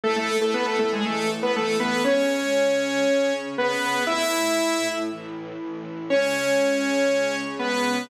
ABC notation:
X:1
M:4/4
L:1/16
Q:1/4=119
K:C#m
V:1 name="Lead 2 (sawtooth)"
[A,A] [A,A]2 [A,A] [B,B] [A,A] [A,A] [G,G] [A,A]2 z [B,B] [A,A]2 [B,B]2 | [Cc]12 [B,B]4 | [Ee]8 z8 | [Cc]12 [B,B]4 |]
V:2 name="String Ensemble 1"
[A,EA]8 [E,A,A]8 | [C,G,C]8 [C,CG]8 | [A,,A,E]8 [A,,E,E]8 | [C,G,C]16 |]